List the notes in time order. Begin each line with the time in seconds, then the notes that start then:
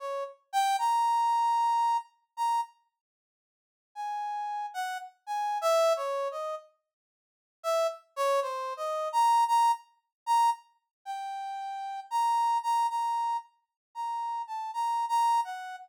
0.00 C#5
0.53 G5
0.79 A#5
2.37 A#5
3.95 G#5
4.74 F#5
5.27 G#5
5.61 E5
5.96 C#5
6.31 D#5
7.63 E5
8.16 C#5
8.42 C5
8.77 D#5
9.13 A#5
9.48 A#5
10.26 A#5
11.05 G5
12.11 A#5
12.63 A#5
12.90 A#5
13.95 A#5
14.47 A5
14.74 A#5
15.09 A#5
15.45 F#5